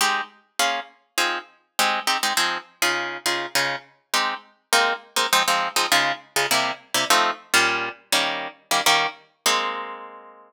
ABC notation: X:1
M:4/4
L:1/8
Q:1/4=203
K:Ab
V:1 name="Acoustic Guitar (steel)"
[A,CEG]4 [B,DFA]4 | [F,CEA]4 [A,CEG]2 [A,CEG] [A,CEG] | [F,CEA]3 [D,EFA]3 [D,EFA]2 | [D,EFA]4 [A,CEG]4 |
[A,B,CE]3 [A,B,CE] [F,A,CE] [F,A,CE]2 [F,A,CE] | [D,A,EF]3 [D,A,EF] [C,G,B,=E]3 [C,G,B,E] | [F,=A,CE]3 [B,,G,DF]4 [E,G,B,D]- | [E,G,B,D]3 [E,G,B,D] [E,G,B,D]4 |
[A,B,CE]8 |]